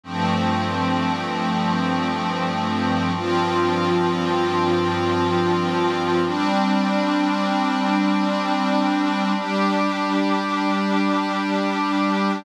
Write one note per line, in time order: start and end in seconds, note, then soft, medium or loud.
0.03 3.11 G2 medium
0.03 3.11 F3 medium
0.03 3.11 A3 medium
0.03 3.11 C4 medium
3.14 6.21 G2 medium
3.14 6.21 F3 medium
3.14 6.21 C4 medium
3.14 6.21 F4 medium
6.24 9.31 G3 medium
6.24 9.31 C4 medium
6.24 9.31 D4 medium
9.34 12.42 G3 medium
9.34 12.42 D4 medium
9.34 12.42 G4 medium